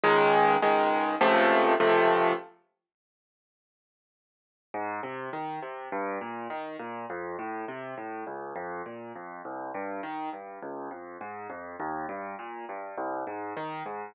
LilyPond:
\new Staff { \time 4/4 \key des \major \tempo 4 = 102 <des, ees aes>4 <des, ees aes>4 <des, c f a>4 <des, c f a>4 | r1 | \key aes \major aes,8 c8 ees8 c8 g,8 bes,8 ees8 bes,8 | f,8 a,8 c8 a,8 des,8 f,8 bes,8 f,8 |
c,8 g,8 ees8 g,8 des,8 f,8 aes,8 f,8 | ees,8 g,8 bes,8 g,8 c,8 aes,8 ees8 aes,8 | }